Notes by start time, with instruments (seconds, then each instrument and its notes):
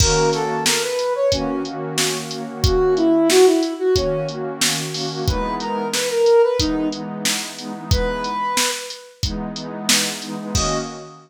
0.00 pad 2 (warm) D#3 A#3 C#4 F#4, flute A#4, kick, crash
0.33 flute A4, snare, closed hi-hat
0.66 flute A#4, snare
0.82 flute B4
0.99 closed hi-hat
1.15 flute C#5
1.32 pad 2 (warm) D#3 A#3 C#4 F#4, flute C#4, kick, closed hi-hat
1.65 pad 2 (warm) D#3 A#3 C#4 F#4, closed hi-hat
1.98 snare
2.31 pad 2 (warm) D#3 A#3 C#4 F#4, closed hi-hat
2.48 pad 2 (warm) D#3 A#3 C#4 F#4
2.64 flute F#4, kick, closed hi-hat
2.96 flute E4, closed hi-hat
3.30 flute F#4, snare
3.46 flute E4
3.63 closed hi-hat
3.79 flute F#4
3.95 pad 2 (warm) D#3 A#3 C#4 F#4, flute C#4, kick, closed hi-hat
4.28 pad 2 (warm) D#3 A#3 C#4 F#4, closed hi-hat
4.61 snare
4.94 pad 2 (warm) D#3 A#3 C#4 F#4, open hi-hat
5.11 pad 2 (warm) D#3 A#3 C#4 F#4
5.27 pad 2 (warm) E3 G#3 B3 D#4, flute B4, kick, closed hi-hat
5.60 flute A#4, closed hi-hat
5.93 flute B4, snare
6.10 flute A#4
6.26 closed hi-hat
6.43 flute B4
6.59 pad 2 (warm) E3 G#3 B3 D#4, flute D#4, kick, closed hi-hat
6.92 pad 2 (warm) E3 G#3 B3 D#4, closed hi-hat
7.25 snare
7.59 pad 2 (warm) E3 G#3 B3 D#4, closed hi-hat
7.74 pad 2 (warm) E3 G#3 B3 D#4
7.91 flute B4, kick, closed hi-hat
8.24 closed hi-hat
8.57 snare
8.90 closed hi-hat
9.23 pad 2 (warm) E3 G#3 B3 D#4, kick, closed hi-hat
9.56 pad 2 (warm) E3 G#3 B3 D#4, closed hi-hat
9.89 snare
10.22 pad 2 (warm) E3 G#3 B3 D#4, closed hi-hat
10.38 pad 2 (warm) E3 G#3 B3 D#4
10.55 pad 2 (warm) D#3 A#3 C#4 F#4, flute D#5, kick, crash